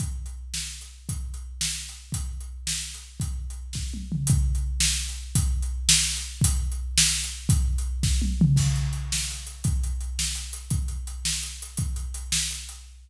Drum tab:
CC |------------|------------|------------|------------|
HH |x--x-----x--|x--x-----x--|x--x-----x--|x--x--------|
SD |------o-----|------o-----|------o-----|------o-----|
T1 |------------|------------|------------|--------o---|
T2 |------------|------------|------------|----------o-|
BD |o-----------|o-----------|o-----------|o-----o-----|

CC |------------|------------|------------|------------|
HH |x--x-----x--|x--x-----x--|x--x-----x--|x--x--------|
SD |------o-----|------o-----|------o-----|------o-----|
T1 |------------|------------|------------|--------o---|
T2 |------------|------------|------------|----------o-|
BD |o-----------|o-----------|o-----------|o-----o-----|

CC |x-----------|------------|------------|------------|
HH |--x-x---x-x-|x-x-x---x-x-|x-x-x---x-x-|x-x-x---x-x-|
SD |------o-----|------o-----|------o-----|------o-----|
T1 |------------|------------|------------|------------|
T2 |------------|------------|------------|------------|
BD |o-----------|o-----------|o-----------|o-----------|